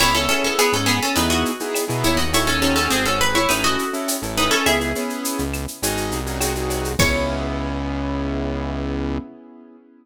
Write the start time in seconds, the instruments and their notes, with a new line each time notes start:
0.00 synth bass 1 C#2, acoustic grand piano B3 C#4 E4 G#4, acoustic guitar (steel) E4 C#5, crash, cowbell, claves
0.15 acoustic grand piano B3 C#4 E4 G#4, acoustic guitar (steel) C#4 A4, shaker
0.29 acoustic grand piano B3 C#4 E4 G#4, acoustic guitar (steel) C#4 A4, shaker
0.44 acoustic guitar (steel) C#4 A4, shaker
0.58 acoustic guitar (steel) B3 G#4, shaker
0.73 synth bass 1 G#2, acoustic guitar (steel) C#4 A4, shaker
0.86 acoustic guitar (steel) B3 G#4, claves, shaker
1.02 acoustic guitar (steel) C#4 A4, shaker
1.16 synth bass 1 E2, acoustic grand piano B3 D#4 E4 G#4, acoustic guitar (steel) D#4 B4, cowbell, shaker
1.30 acoustic guitar (steel) F#4 D#5, shaker
1.45 shaker
1.60 acoustic grand piano B3 D#4 E4 G#4, shaker
1.75 cowbell, claves, shaker
1.88 synth bass 1 B2, acoustic grand piano B3 D#4 E4 G#4, shaker
2.04 synth bass 1 D#2, acoustic guitar (steel) E4 C#5, cowbell, shaker
2.17 acoustic guitar (steel) F#4 D#5, shaker
2.33 acoustic grand piano C#4 D#4 F#4 A4, acoustic guitar (steel) E4 C#5, cowbell, shaker
2.47 acoustic guitar (steel) C#4 A4, acoustic grand piano C#4 D#4 F#4 A4, shaker
2.62 acoustic grand piano C4 D#4 F#4 G#4, acoustic guitar (steel) C#4 A4, shaker
2.76 acoustic guitar (steel) C#4 A4, shaker
2.90 synth bass 1 G#1, acoustic guitar (steel) C4 G#4, claves, shaker
3.05 acoustic guitar (steel) C#4 A4, shaker
3.21 acoustic guitar (steel) B4, shaker
3.35 acoustic guitar (steel) E4 C#5, shaker
3.49 synth bass 1 A1, acoustic grand piano C#4 E4 A4, acoustic guitar (steel) D#4 B4, cowbell, claves, shaker
3.64 acoustic guitar (steel) F#4 D#5, shaker
3.79 shaker
3.93 acoustic grand piano C#4 E4 A4, shaker
4.08 cowbell, shaker
4.22 synth bass 1 A1, acoustic grand piano C#4 E4 A4, shaker
4.37 acoustic guitar (steel) D#4 B4, cowbell, shaker
4.51 acoustic guitar (steel) C#4 A4, shaker
4.66 synth bass 1 C#2, acoustic grand piano B3 C#4 E4 G#4, acoustic guitar (steel) G#4 E5, cowbell, claves, shaker
4.79 acoustic grand piano B3 C#4 E4 G#4, shaker
4.95 acoustic grand piano B3 C#4 E4 G#4, shaker
5.10 shaker
5.25 shaker
5.38 synth bass 1 C#2, shaker
5.53 claves, shaker
5.68 shaker
5.83 synth bass 1 G#1, acoustic grand piano C#4 D#4 F#4 G#4, cowbell, shaker
5.97 shaker
6.12 synth bass 1 C2, shaker
6.26 acoustic grand piano C#4 D#4 F#4 G#4, shaker
6.41 acoustic grand piano C4 D#4 F#4 G#4, cowbell, claves, shaker
6.55 acoustic grand piano C4 D#4 F#4 G#4, shaker
6.70 cowbell, shaker
6.85 shaker
6.99 synth bass 1 C#2, acoustic grand piano B3 C#4 E4 G#4, acoustic guitar (steel) C#5, kick, crash